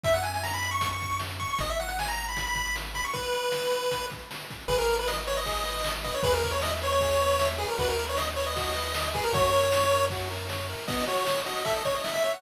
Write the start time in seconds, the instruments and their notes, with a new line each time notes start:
0.04 synth bass 1 F#2, lead 1 (square) E5, kick, closed hi-hat
0.14 lead 1 (square) F#5, closed hi-hat
0.23 lead 1 (square) G#5, closed hi-hat
0.34 lead 1 (square) G#5, closed hi-hat
0.43 lead 1 (square) A#5, snare
0.54 lead 1 (square) B5, closed hi-hat
0.62 closed hi-hat
0.71 lead 1 (square) C#6, closed hi-hat
0.81 kick, closed hi-hat
0.91 lead 1 (square) C#6, closed hi-hat
1.00 kick, closed hi-hat
1.10 closed hi-hat
1.19 snare
1.30 closed hi-hat
1.40 lead 1 (square) C#6, kick, closed hi-hat
1.49 lead 1 (square) C#6, closed hi-hat
1.58 synth bass 1 G#1, lead 1 (square) D#5, kick, closed hi-hat
1.69 lead 1 (square) E5, closed hi-hat
1.80 lead 1 (square) F#5, closed hi-hat
1.88 lead 1 (square) F#5, closed hi-hat
1.99 lead 1 (square) G#5, snare
2.06 lead 1 (square) A#5, closed hi-hat
2.18 closed hi-hat
2.28 lead 1 (square) B5, closed hi-hat
2.37 kick, closed hi-hat
2.47 lead 1 (square) B5, closed hi-hat
2.55 kick, closed hi-hat
2.65 closed hi-hat
2.76 snare
2.85 closed hi-hat
2.94 lead 1 (square) B5, kick, closed hi-hat
3.04 lead 1 (square) C#6, open hi-hat
3.13 lead 1 (square) B4, kick, closed hi-hat
3.24 closed hi-hat
3.33 closed hi-hat
3.43 closed hi-hat
3.52 snare
3.63 closed hi-hat
3.71 closed hi-hat
3.83 closed hi-hat
3.91 kick, closed hi-hat
4.01 closed hi-hat
4.10 kick, closed hi-hat
4.19 closed hi-hat
4.31 snare
4.40 closed hi-hat
4.50 kick, closed hi-hat
4.60 closed hi-hat
4.68 synth bass 1 G#1, lead 1 (square) G#4 B4, kick, crash
4.78 lead 1 (square) A#4
4.88 lead 1 (square) B4, ride
4.99 lead 1 (square) B4
5.07 lead 1 (square) D#5, snare
5.27 lead 1 (square) B4 C#5, ride
5.37 lead 1 (square) D#5
5.46 lead 1 (square) G#4, kick, ride
5.65 lead 1 (square) B4, ride
5.84 lead 1 (square) D#5, snare
6.04 lead 1 (square) B4 D#5, kick, ride
6.14 lead 1 (square) C#5
6.23 synth bass 1 E2, lead 1 (square) G#4 B4, kick, ride
6.33 lead 1 (square) A#4
6.43 lead 1 (square) B4, kick, ride
6.51 lead 1 (square) C#5
6.62 lead 1 (square) D#5 E5, snare
6.82 lead 1 (square) B4 C#5, ride
6.92 lead 1 (square) C#5
7.00 lead 1 (square) G#4, kick, ride
7.20 lead 1 (square) B4, ride
7.39 lead 1 (square) E5, snare
7.58 lead 1 (square) G#4 B4, ride
7.68 lead 1 (square) A#4
7.78 synth bass 1 D#2, lead 1 (square) F#4 B4, kick, ride
7.88 lead 1 (square) A#4
7.98 lead 1 (square) B4, ride
8.09 lead 1 (square) C#5
8.17 lead 1 (square) D#5, snare
8.36 lead 1 (square) B4 C#5, ride
8.47 lead 1 (square) D#5
8.56 lead 1 (square) F#4, kick, ride
8.75 lead 1 (square) B4, ride
8.94 lead 1 (square) D#5, snare
9.14 lead 1 (square) G#4 B4, kick, ride
9.24 lead 1 (square) A#4
9.33 synth bass 1 F#2, lead 1 (square) F#4 C#5, kick, ride
9.52 lead 1 (square) A#4, ride
9.72 lead 1 (square) C#5, snare
9.91 lead 1 (square) A#4, ride
10.10 lead 1 (square) F#4, kick, ride
10.30 lead 1 (square) A#4, ride
10.49 lead 1 (square) C#5, snare
10.69 lead 1 (square) A#4, ride
10.88 lead 1 (square) B3 D#5, kick, crash
10.98 closed hi-hat
11.08 lead 1 (square) F#4 C#5, closed hi-hat
11.17 closed hi-hat
11.26 lead 1 (square) D#5, snare
11.35 closed hi-hat
11.46 lead 1 (square) F#4 D#5, closed hi-hat
11.56 closed hi-hat
11.65 lead 1 (square) A4 E5, kick, closed hi-hat
11.76 lead 1 (square) D#5, closed hi-hat
11.85 lead 1 (square) C#5, kick, closed hi-hat
11.94 lead 1 (square) D#5, closed hi-hat
12.04 lead 1 (square) E5, snare
12.14 lead 1 (square) E5, closed hi-hat
12.24 lead 1 (square) C#5 E5, closed hi-hat
12.33 lead 1 (square) F#5, closed hi-hat